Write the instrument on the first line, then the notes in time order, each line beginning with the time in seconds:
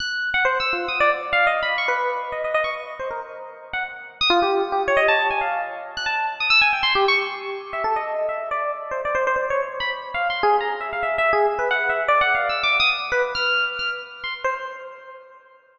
electric piano 1
0.00 F#6
0.34 F#5
0.45 C5
0.60 E6
0.73 F4
0.88 D#6
1.00 D5
1.33 F5
1.47 D#5
1.62 B5
1.78 C#6
1.88 B4
2.32 D#5
2.44 D#5
2.54 D#5
2.64 C#6
2.99 C5
3.10 A#4
3.73 F#5
4.21 D#6
4.30 F4
4.42 G4
4.72 G4
4.88 C#5
4.97 D#5
5.08 A5
5.30 G#5
5.41 F5
5.97 F#6
6.06 A5
6.40 D#6
6.50 E6
6.61 G#5
6.73 G5
6.83 C6
6.95 G4
7.08 C#6
7.73 E5
7.84 A4
7.96 D#5
8.28 E5
8.51 D5
8.91 C5
9.05 D5
9.15 C5
9.27 C5
9.36 C5
9.50 C#5
9.80 B5
10.14 F5
10.30 C6
10.43 G#4
10.60 A#5
10.80 E5
10.93 F5
11.03 E5
11.18 E5
11.33 G#4
11.59 B4
11.70 F#5
11.89 E5
12.08 D5
12.21 F#5
12.34 F5
12.49 E6
12.63 D6
12.80 D#6
13.12 B4
13.35 F6
13.79 F6
14.23 C6
14.44 C5